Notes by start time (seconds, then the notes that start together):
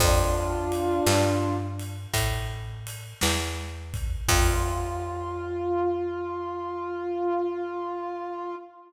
0.00 F2 D4 F4, kick, crash
0.72 ride
1.06 G2, snare
1.79 ride
2.14 A2, kick, ride
2.87 ride
3.21 E2, snare
3.94 kick, ride
4.28 F2 F4, kick, crash